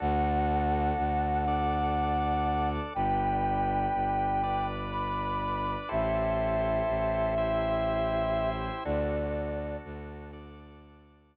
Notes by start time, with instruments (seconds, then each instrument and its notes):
0.00 violin D2, drawbar organ D4 F#4 A4, flute F#5
0.98 violin D2
1.48 drawbar organ D4 A4 D5
2.94 violin G1, drawbar organ D4 G4 B4, flute G5
3.94 violin G1
4.43 drawbar organ D4 B4 D5
4.91 flute B5
5.89 violin A1, drawbar organ E4 G4 A4 C5, flute E5
6.89 violin A1
7.38 drawbar organ E4 G4 C5 E5
8.85 violin D2, drawbar organ D4 F#4 A4, flute D5
9.85 violin D2
10.33 drawbar organ D4 A4 D5